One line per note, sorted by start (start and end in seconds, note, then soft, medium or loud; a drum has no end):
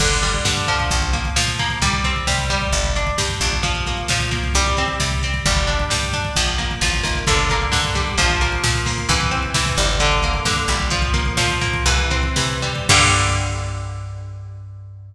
0.00 0.39 G1 medium
0.00 0.44 D3 medium
0.00 kick medium
0.00 crash medium
0.11 kick medium
0.22 0.87 G3 medium
0.22 kick medium
0.22 closed hi-hat medium
0.34 kick medium
0.45 0.84 G2 medium
0.45 0.88 D3 medium
0.45 kick medium
0.45 snare loud
0.57 kick medium
0.67 1.36 F3 medium
0.67 kick medium
0.67 closed hi-hat medium
0.80 kick medium
0.91 1.30 A#1 medium
0.91 kick medium
0.91 closed hi-hat medium
1.02 kick medium
1.13 1.59 A#3 medium
1.13 kick medium
1.13 closed hi-hat medium
1.25 kick medium
1.36 1.75 A#2 medium
1.36 1.79 F3 medium
1.36 snare loud
1.47 kick medium
1.59 1.81 A#3 medium
1.59 kick medium
1.59 closed hi-hat medium
1.70 kick medium
1.82 2.20 C2 medium
1.82 2.27 G3 loud
1.82 kick medium
1.82 closed hi-hat medium
1.93 kick medium
2.04 2.69 C4 medium
2.04 kick medium
2.04 closed hi-hat medium
2.16 kick medium
2.27 2.66 C3 medium
2.27 2.50 G3 medium
2.27 kick medium
2.27 snare medium
2.38 kick medium
2.50 3.17 G3 loud
2.50 kick medium
2.50 closed hi-hat medium
2.62 kick medium
2.72 3.11 G1 medium
2.72 kick medium
2.72 closed hi-hat medium
2.84 kick medium
2.95 3.42 D4 medium
2.95 kick medium
2.95 closed hi-hat medium
3.07 kick medium
3.18 3.40 G2 medium
3.18 3.61 G3 medium
3.18 kick medium
3.18 snare medium
3.29 kick medium
3.41 4.02 A#1 medium
3.41 3.64 D4 medium
3.41 kick medium
3.41 closed hi-hat medium
3.52 kick medium
3.63 4.10 F3 medium
3.63 kick medium
3.63 closed hi-hat medium
3.75 kick medium
3.86 4.31 A#3 medium
3.86 kick medium
3.86 closed hi-hat medium
3.97 kick medium
4.08 4.48 A#2 medium
4.08 4.53 F3 medium
4.08 kick medium
4.08 snare loud
4.20 kick medium
4.31 4.53 A#3 medium
4.31 kick medium
4.31 closed hi-hat medium
4.44 kick medium
4.54 4.93 C2 medium
4.54 5.00 G3 medium
4.54 kick medium
4.54 closed hi-hat loud
4.66 kick medium
4.77 5.23 C4 medium
4.77 kick medium
4.77 closed hi-hat medium
4.88 kick medium
5.00 5.39 C3 medium
5.00 5.43 G3 medium
5.00 kick medium
5.00 snare medium
5.11 kick medium
5.22 5.45 C4 medium
5.22 kick medium
5.22 closed hi-hat medium
5.34 kick medium
5.46 5.84 G1 medium
5.46 5.90 G3 medium
5.46 kick loud
5.46 closed hi-hat soft
5.57 kick medium
5.67 6.13 D4 medium
5.67 kick medium
5.67 closed hi-hat medium
5.80 kick medium
5.90 6.30 G2 medium
5.90 6.33 G3 medium
5.90 kick medium
5.90 snare loud
6.03 kick medium
6.13 6.35 D4 medium
6.13 kick medium
6.13 closed hi-hat medium
6.25 kick medium
6.36 6.75 A#1 medium
6.36 6.81 F3 medium
6.36 kick medium
6.36 closed hi-hat loud
6.48 kick medium
6.58 7.03 A#3 medium
6.58 kick medium
6.58 closed hi-hat medium
6.71 kick medium
6.81 7.02 A1 medium
6.81 7.25 F3 medium
6.81 kick medium
6.81 snare medium
6.94 kick medium
7.03 7.25 G#1 medium
7.03 7.25 A#3 medium
7.03 kick medium
7.03 closed hi-hat medium
7.15 kick medium
7.27 7.66 G1 medium
7.27 7.71 D3 medium
7.27 kick loud
7.27 closed hi-hat loud
7.39 kick medium
7.49 8.16 A#3 medium
7.49 kick medium
7.49 closed hi-hat medium
7.62 kick medium
7.72 8.11 G2 medium
7.72 8.15 D3 medium
7.72 kick medium
7.72 snare medium
7.84 kick medium
7.95 8.17 G3 medium
7.95 kick medium
7.95 closed hi-hat medium
8.07 kick medium
8.18 8.57 A#1 medium
8.18 8.63 F3 loud
8.18 kick medium
8.18 closed hi-hat medium
8.30 kick medium
8.41 8.86 A#3 medium
8.41 kick medium
8.41 closed hi-hat medium
8.52 kick medium
8.64 9.02 A#2 medium
8.64 9.07 F3 medium
8.64 kick medium
8.64 snare loud
8.75 kick medium
8.86 9.08 A#3 medium
8.86 kick medium
8.86 open hi-hat medium
8.98 kick medium
9.09 9.48 C2 medium
9.09 9.54 E3 loud
9.09 kick loud
9.09 closed hi-hat medium
9.20 kick medium
9.31 9.96 C4 medium
9.31 kick medium
9.31 closed hi-hat medium
9.43 kick medium
9.54 9.76 C3 medium
9.54 9.98 E3 medium
9.54 kick medium
9.54 snare loud
9.66 kick medium
9.77 10.39 G1 medium
9.77 9.99 G3 medium
9.77 kick medium
9.77 closed hi-hat medium
9.89 kick medium
10.00 10.45 D3 loud
10.00 kick medium
10.00 closed hi-hat medium
10.12 kick medium
10.22 10.88 A#3 medium
10.22 kick medium
10.22 closed hi-hat medium
10.34 kick medium
10.45 10.67 G2 medium
10.45 10.89 D3 medium
10.45 kick medium
10.45 snare medium
10.57 kick medium
10.68 11.30 A#1 medium
10.68 10.90 G3 medium
10.68 kick medium
10.68 closed hi-hat medium
10.80 kick medium
10.90 11.37 F3 medium
10.90 kick medium
10.90 closed hi-hat medium
11.02 kick medium
11.14 11.61 A#3 medium
11.14 kick medium
11.14 closed hi-hat medium
11.25 kick medium
11.37 11.78 A#2 medium
11.37 11.84 F3 medium
11.37 kick medium
11.37 snare loud
11.49 kick medium
11.61 11.85 A#3 medium
11.61 kick medium
11.61 closed hi-hat medium
11.73 kick medium
11.86 12.29 C2 medium
11.86 12.36 E3 medium
11.86 kick medium
11.86 closed hi-hat medium
11.98 kick medium
12.10 12.86 C4 medium
12.10 kick medium
12.10 closed hi-hat medium
12.23 kick medium
12.36 12.81 C3 medium
12.36 12.87 E3 medium
12.36 kick medium
12.36 snare medium
12.49 kick medium
12.62 12.88 G3 medium
12.62 kick medium
12.62 closed hi-hat medium
12.76 kick medium
12.89 15.14 G2 loud
12.89 15.15 D3 loud
12.89 15.15 G3 loud
12.89 15.15 A#3 loud
12.89 kick loud
12.89 crash loud